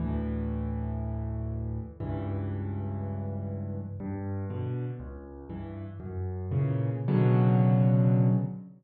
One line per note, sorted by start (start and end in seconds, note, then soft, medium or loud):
0.00 1.79 D2 medium
0.00 1.79 A2 medium
0.00 1.79 E3 medium
2.00 3.80 C#2 medium
2.00 3.80 G2 medium
2.00 3.80 E3 medium
4.00 4.45 G2 loud
4.50 4.85 B2 medium
4.50 4.85 D3 medium
5.00 5.45 C#2 loud
5.50 5.85 G2 medium
5.50 5.85 E3 medium
6.00 6.46 F#2 medium
6.51 6.90 A#2 medium
6.51 6.90 C#3 medium
6.51 6.90 E3 medium
7.08 8.29 B2 loud
7.08 8.29 C#3 loud
7.08 8.29 D3 medium
7.08 8.29 F#3 loud